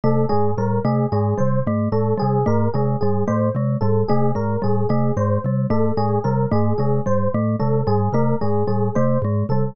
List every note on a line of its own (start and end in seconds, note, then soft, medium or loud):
0.04 0.25 C3 medium
0.04 0.25 A3 medium
0.04 0.25 A4 medium
0.29 0.54 G#2 medium
0.29 0.51 G#3 medium
0.29 0.51 G#4 medium
0.57 0.79 A2 medium
0.57 0.80 G3 medium
0.57 0.80 A#4 medium
0.84 1.06 C3 medium
0.84 1.06 A3 medium
0.84 1.07 G#4 medium
1.12 1.34 G#2 medium
1.12 1.34 G#3 medium
1.12 1.33 G#4 medium
1.38 1.62 C3 medium
1.38 1.59 G3 medium
1.38 1.60 C5 medium
1.67 1.88 G#2 medium
1.67 1.89 A3 medium
1.92 2.14 A2 medium
1.92 2.14 G#3 medium
1.92 2.14 A4 medium
2.17 2.39 G3 medium
2.17 2.41 G#4 medium
2.22 2.44 C3 medium
2.46 2.69 G#2 medium
2.46 2.68 A3 medium
2.46 2.69 A#4 medium
2.74 2.96 C3 medium
2.74 2.97 G#3 medium
2.74 2.95 G#4 medium
3.01 3.24 G#2 medium
3.01 3.24 G3 medium
3.01 3.22 G#4 medium
3.28 3.51 A2 medium
3.28 3.49 A3 medium
3.28 3.49 C5 medium
3.55 3.76 C3 medium
3.55 3.78 G#3 medium
3.81 4.03 G#2 medium
3.81 4.04 G3 medium
3.81 4.02 A4 medium
4.08 4.32 C3 medium
4.08 4.31 A3 medium
4.08 4.30 G#4 medium
4.35 4.57 G#2 medium
4.35 4.57 G#3 medium
4.35 4.57 A#4 medium
4.62 4.86 A2 medium
4.62 4.84 G3 medium
4.62 4.85 G#4 medium
4.89 5.11 C3 medium
4.89 5.12 A3 medium
4.89 5.11 G#4 medium
5.17 5.38 G#2 medium
5.17 5.39 G#3 medium
5.17 5.38 C5 medium
5.44 5.66 C3 medium
5.44 5.67 G3 medium
5.70 5.92 G#2 medium
5.70 5.92 A3 medium
5.70 5.92 A4 medium
5.97 6.19 A2 medium
5.97 6.19 G#3 medium
5.97 6.19 G#4 medium
6.24 6.46 C3 medium
6.24 6.46 G3 medium
6.24 6.46 A#4 medium
6.51 6.73 G#2 medium
6.51 6.73 A3 medium
6.51 6.74 G#4 medium
6.78 7.00 C3 medium
6.78 7.01 G#3 medium
6.78 6.99 G#4 medium
7.06 7.28 G#2 medium
7.06 7.27 G3 medium
7.06 7.28 C5 medium
7.34 7.56 A2 medium
7.34 7.56 A3 medium
7.60 7.83 C3 medium
7.60 7.81 G#3 medium
7.60 7.81 A4 medium
7.87 8.09 G#2 medium
7.87 8.09 G3 medium
7.87 8.09 G#4 medium
8.13 8.34 C3 medium
8.13 8.36 A3 medium
8.13 8.35 A#4 medium
8.41 8.64 G#2 medium
8.41 8.63 G#3 medium
8.41 8.63 G#4 medium
8.67 8.90 A2 medium
8.67 8.89 G3 medium
8.67 8.89 G#4 medium
8.95 9.18 C3 medium
8.95 9.18 A3 medium
8.95 9.17 C5 medium
9.22 9.44 G#2 medium
9.22 9.46 G#3 medium
9.49 9.71 C3 medium
9.49 9.73 G3 medium
9.49 9.71 A4 medium